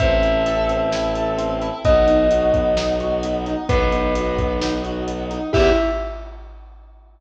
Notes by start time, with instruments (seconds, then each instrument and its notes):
0.00 violin A1, choir aahs C4 E4 A4, acoustic grand piano C4, tubular bells E5, kick, closed hi-hat
0.23 acoustic grand piano E4, closed hi-hat
0.46 acoustic grand piano A4, closed hi-hat
0.69 acoustic grand piano C4, closed hi-hat
0.91 acoustic grand piano E4, snare
1.15 acoustic grand piano A4, closed hi-hat
1.38 acoustic grand piano C4, closed hi-hat
1.62 acoustic grand piano E4, closed hi-hat
1.84 violin B1, choir aahs B3 D#4 F#4, acoustic grand piano B3, tubular bells D#5, kick, closed hi-hat
2.07 acoustic grand piano D#4, closed hi-hat
2.31 acoustic grand piano F#4, closed hi-hat
2.54 acoustic grand piano B3, kick, closed hi-hat
2.77 acoustic grand piano D#4, snare
3.00 acoustic grand piano F#4, closed hi-hat
3.23 acoustic grand piano B3, closed hi-hat
3.46 acoustic grand piano D#4, closed hi-hat
3.69 violin B1, acoustic grand piano B3, choir aahs B3 D#4 F#4, tubular bells B4, kick, closed hi-hat
3.92 acoustic grand piano D#4, closed hi-hat
4.15 acoustic grand piano F#4, closed hi-hat
4.38 acoustic grand piano B3, kick, closed hi-hat
4.61 acoustic grand piano D#4, snare
4.83 acoustic grand piano F#4, closed hi-hat
5.07 acoustic grand piano B3, closed hi-hat
5.30 acoustic grand piano D#4, closed hi-hat
5.53 violin E2, choir aahs B3 E4 G4, acoustic grand piano E4 G4 B4, tubular bells E5, kick, crash